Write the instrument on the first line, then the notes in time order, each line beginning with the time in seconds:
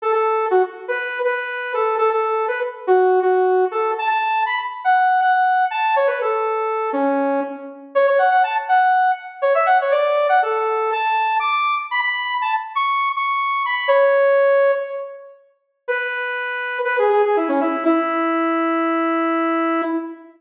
lead 2 (sawtooth)
0.02 A4
0.12 A4
0.51 F#4
0.88 B4
1.24 B4
1.74 A4
1.98 A4
2.11 A4
2.48 B4
2.87 F#4
3.22 F#4
3.71 A4
3.98 A5
4.08 A5
4.46 B5
4.84 F#5
5.21 F#5
5.71 A5
5.96 C#5
6.07 B4
6.21 A4
6.93 C#4
7.95 C#5
8.07 C#5
8.18 F#5
8.31 F#5
8.43 A5
8.69 F#5
9.42 C#5
9.55 E5
9.66 F#5
9.81 C#5
9.91 D5
10.29 F#5
10.42 A4
10.92 A5
11.39 D6
11.91 B5
12.01 B5
12.42 A5
12.75 C#6
13.16 C#6
13.66 B5
13.88 C#5
15.88 B4
16.85 B4
16.99 G#4
17.10 G#4
17.24 G#4
17.36 E4
17.49 C#4
17.61 E4
17.85 E4